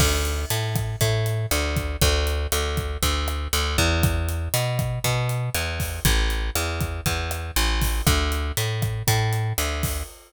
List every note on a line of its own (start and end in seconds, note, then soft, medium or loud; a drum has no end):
0.00 0.45 D2 loud
0.00 kick medium
0.00 cross-stick medium
0.00 crash medium
0.25 closed hi-hat medium
0.50 0.96 A2 medium
0.50 closed hi-hat medium
0.75 kick medium
0.75 cross-stick medium
0.75 closed hi-hat medium
1.01 1.46 A2 loud
1.01 kick medium
1.01 closed hi-hat medium
1.26 closed hi-hat medium
1.51 1.97 D2 loud
1.51 cross-stick medium
1.51 closed hi-hat medium
1.76 kick medium
1.76 closed hi-hat medium
2.01 2.47 D2 loud
2.01 kick medium
2.01 closed hi-hat medium
2.27 closed hi-hat medium
2.52 2.97 D2 medium
2.52 cross-stick medium
2.52 closed hi-hat loud
2.77 kick medium
2.77 closed hi-hat medium
3.03 3.48 D2 loud
3.03 kick medium
3.03 closed hi-hat medium
3.28 cross-stick medium
3.28 closed hi-hat medium
3.53 3.77 D2 medium
3.53 closed hi-hat medium
3.78 4.49 E2 loud
3.78 kick medium
3.78 closed hi-hat medium
4.03 kick loud
4.03 cross-stick medium
4.03 closed hi-hat medium
4.29 closed hi-hat medium
4.54 4.99 B2 medium
4.54 closed hi-hat loud
4.79 kick medium
4.79 cross-stick medium
4.79 closed hi-hat medium
5.04 5.50 B2 loud
5.04 kick medium
5.04 closed hi-hat medium
5.29 closed hi-hat medium
5.55 6.00 E2 medium
5.55 cross-stick medium
5.55 closed hi-hat medium
5.80 kick medium
5.80 open hi-hat medium
6.05 6.50 A1 loud
6.05 kick medium
6.05 closed hi-hat loud
6.30 closed hi-hat medium
6.55 7.01 E2 medium
6.55 cross-stick medium
6.55 closed hi-hat medium
6.81 kick medium
6.81 closed hi-hat medium
7.06 7.51 E2 medium
7.06 kick medium
7.06 closed hi-hat medium
7.31 cross-stick medium
7.31 closed hi-hat medium
7.56 8.02 A1 loud
7.56 closed hi-hat medium
7.82 kick medium
7.82 open hi-hat medium
8.07 8.52 D2 loud
8.07 kick medium
8.07 cross-stick loud
8.07 closed hi-hat medium
8.32 closed hi-hat medium
8.57 9.03 A2 medium
8.57 closed hi-hat medium
8.82 kick medium
8.82 cross-stick medium
8.82 closed hi-hat medium
9.07 9.53 A2 loud
9.07 kick medium
9.07 closed hi-hat loud
9.33 closed hi-hat medium
9.58 10.03 D2 medium
9.58 cross-stick medium
9.58 closed hi-hat loud
9.83 kick medium
9.83 open hi-hat medium